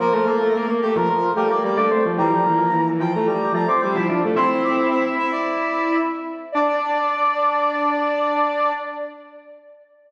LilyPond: <<
  \new Staff \with { instrumentName = "Brass Section" } { \time 4/4 \key d \minor \tempo 4 = 110 bes'4. g'16 bes'16 bes'8 bes'16 d''16 d''8 r8 | bes''4. g''16 bes''16 bes''8 bes''16 d'''16 d'''8 r8 | c'''16 c'''16 d'''8 e''8 e''16 d''4~ d''16 r4 | d''1 | }
  \new Staff \with { instrumentName = "Flute" } { \time 4/4 \key d \minor <bes bes'>16 <a a'>16 <bes bes'>16 <a a'>16 <bes bes'>16 <bes bes'>16 <a a'>16 <f f'>16 r8 <a a'>16 r16 <g g'>16 <a a'>16 <a a'>16 <f f'>16 | <e e'>16 <f f'>16 <e e'>16 <f f'>16 <e e'>16 <e e'>16 <f f'>16 <a a'>16 r8 <f f'>16 r16 <g g'>16 <f f'>16 <f f'>16 <a a'>16 | <c' c''>4. r2 r8 | d''1 | }
  \new Staff \with { instrumentName = "Drawbar Organ" } { \time 4/4 \key d \minor f16 f16 a8 r4 f8 g16 bes16 bes16 d'16 c'16 r16 | g16 g16 bes8 r4 g8 a16 c'16 c'16 e'16 d'16 r16 | e'2.~ e'8 r8 | d'1 | }
>>